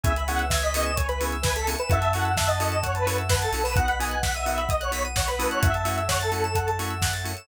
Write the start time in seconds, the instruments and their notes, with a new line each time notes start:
0.03 synth bass 2 C#2, drawbar organ B3 C#4 E4 G#4, pad 2 (warm) B4 C#5 E5 G#5, lead 1 (square) E5 G#5, kick, closed hi-hat
0.16 lead 1 (square) B5, closed hi-hat
0.28 drawbar organ B3 C#4 E4 G#4, lead 1 (square) F#5 C#6, open hi-hat
0.39 lead 1 (square) E6, closed hi-hat
0.50 lead 1 (square) E5 G#6, kick, snare
0.62 lead 1 (square) D#5 B6, closed hi-hat
0.74 drawbar organ B3 C#4 E4 G#4, lead 1 (square) D#5 C#7, open hi-hat
0.85 lead 1 (square) E7, closed hi-hat
0.96 lead 1 (square) C#5 G#5, kick, closed hi-hat
1.08 lead 1 (square) B4 B5, closed hi-hat
1.20 drawbar organ B3 C#4 E4 G#4, lead 1 (square) C#6, open hi-hat
1.32 lead 1 (square) E6, closed hi-hat
1.43 lead 1 (square) B4 G#6, kick, snare
1.56 lead 1 (square) A4 B6, closed hi-hat
1.67 drawbar organ B3 C#4 E4 G#4, lead 1 (square) C#7, open hi-hat
1.79 lead 1 (square) B4 E7, closed hi-hat
1.90 synth bass 2 F#2, drawbar organ C#4 E4 F#4 A4, pad 2 (warm) C#5 E5 F#5 A5, lead 1 (square) E5 F#5, kick, closed hi-hat
2.01 lead 1 (square) A5, closed hi-hat
2.12 drawbar organ C#4 E4 F#4 A4, lead 1 (square) F#5 C#6, open hi-hat
2.24 lead 1 (square) E6, closed hi-hat
2.37 lead 1 (square) E5 F#6, kick, snare
2.48 lead 1 (square) D#5 A6, closed hi-hat
2.60 drawbar organ C#4 E4 F#4 A4, lead 1 (square) D#5 C#7, open hi-hat
2.72 lead 1 (square) E7, closed hi-hat
2.83 lead 1 (square) C#5 F#5, kick, closed hi-hat
2.95 lead 1 (square) B4 A5, closed hi-hat
3.06 drawbar organ C#4 E4 F#4 A4, lead 1 (square) C#6, open hi-hat
3.18 lead 1 (square) E6, closed hi-hat
3.29 lead 1 (square) B4 F#6, kick, snare
3.42 lead 1 (square) A4 A6, closed hi-hat
3.52 synth bass 2 B1, drawbar organ C#4 E4 F#4 A4, lead 1 (square) C#7, open hi-hat
3.64 lead 1 (square) B4 E7, open hi-hat
3.76 drawbar organ B3 D#4 F#4, pad 2 (warm) B4 D#5 F#5, lead 1 (square) F#5, kick, closed hi-hat
3.88 lead 1 (square) B5, closed hi-hat
3.99 drawbar organ B3 D#4 F#4, lead 1 (square) G#5 D#6, open hi-hat
4.10 lead 1 (square) F#6, closed hi-hat
4.22 lead 1 (square) F#5 B6, kick, snare
4.34 lead 1 (square) E5 D#7, closed hi-hat
4.45 drawbar organ B3 D#4 F#4, lead 1 (square) E5 F#5, open hi-hat
4.58 lead 1 (square) B5, closed hi-hat
4.69 lead 1 (square) D#5 D#6, kick, closed hi-hat
4.80 lead 1 (square) C#5 F#6, closed hi-hat
4.91 drawbar organ B3 D#4 F#4, lead 1 (square) B6, open hi-hat
5.05 lead 1 (square) D#7, closed hi-hat
5.16 lead 1 (square) C#5 F#5, kick, snare
5.28 lead 1 (square) B4 B5, closed hi-hat
5.39 drawbar organ A3 C#4 E4 F#4, lead 1 (square) D#6, open hi-hat
5.51 lead 1 (square) C#5 F#6, closed hi-hat
5.62 synth bass 2 F#2, pad 2 (warm) A4 C#5 E5 F#5, lead 1 (square) E5 F#5, kick, closed hi-hat
5.74 lead 1 (square) A5, closed hi-hat
5.85 drawbar organ A3 C#4 E4 F#4, lead 1 (square) C#6, open hi-hat
5.98 lead 1 (square) E6, closed hi-hat
6.09 lead 1 (square) C#5 F#6, kick, snare
6.20 lead 1 (square) A4 A6, closed hi-hat
6.32 drawbar organ A3 C#4 E4 F#4, lead 1 (square) C#7, open hi-hat
6.44 lead 1 (square) E7, closed hi-hat
6.55 lead 1 (square) F#5, kick, closed hi-hat
6.67 lead 1 (square) A5, closed hi-hat
6.79 drawbar organ A3 C#4 E4 F#4, lead 1 (square) C#6, open hi-hat
6.90 lead 1 (square) E6, closed hi-hat
7.02 lead 1 (square) F#6, kick, snare
7.12 lead 1 (square) A6, closed hi-hat
7.24 drawbar organ A3 C#4 E4 F#4, lead 1 (square) C#7, open hi-hat
7.37 lead 1 (square) E7, closed hi-hat